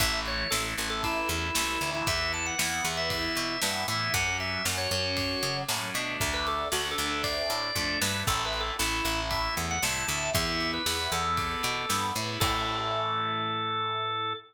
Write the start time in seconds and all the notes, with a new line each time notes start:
0.00 A1 E3 A3 E5, kick, ride
0.26 C#5, ride
0.51 A1 E3 A3 A4, snare
0.78 A1 E3 A3, ride
0.90 A4
1.03 E4, kick, ride
1.29 E2 E4, ride
1.55 C2 E3 A3, snare
1.81 D2 E3 A3, ride
1.95 E4
2.06 E2 E3 B3 E5, kick, ride
2.33 A5, ride
2.46 F#5
2.58 E2 E3 B3, snare
2.84 E2 E3 B3, ride
2.97 E5
3.10 E5, kick, ride
3.36 B2, ride
3.61 G2 E3 B3 E5, snare
3.88 A2 E3 B3 E5, ride
4.14 F#2 F#3 C#4 F#5, kick, ride
4.40 E5, ride
4.65 F#2 F#3 C#4, snare
4.78 C#5
4.91 F#2 F#3 C#4, ride
5.17 kick, ride
5.43 C#3, ride
5.68 A2 F#3 C#4, snare
5.94 B2 A3 D4, ride
6.20 D2, kick, ride
6.34 B4
6.47 A4, ride
6.72 D2 A3 D4 F#4, snare
6.91 A4
6.98 D2 A3 D4, ride
7.06 A4
7.23 D5, kick, ride
7.50 A2, ride
7.75 F2 A3 D4, kick
8.01 G2 A3 D4 B4, snare
8.27 A1 A3 E4 A4, kick, crash
8.45 B4
8.53 ride
8.60 A4
8.79 A1 A3 E4, snare
9.04 A1 A3 E4, ride
9.30 E5, kick, ride
9.57 E2, ride
9.71 F#5
9.82 C2 A3 E4 A5, snare
10.07 D2 A3 E4 A5, ride
10.34 E2 B3 E4 E5, kick, ride
10.60 ride
10.74 B4
10.86 E2 B3 E4, snare
11.12 E2 B3 E4 A4, ride
11.37 kick, ride
11.63 B2, ride
11.89 G2 B3 E4, snare
12.15 A2 B3 E4, ride
12.40 A2 E3 A3 A4, kick, crash